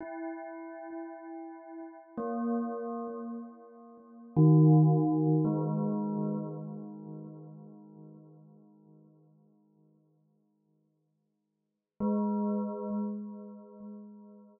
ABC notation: X:1
M:6/8
L:1/8
Q:3/8=37
K:none
V:1 name="Tubular Bells"
E4 ^A,2 | z2 ^D,2 ^G,2 | z6 | z4 ^G,2 |]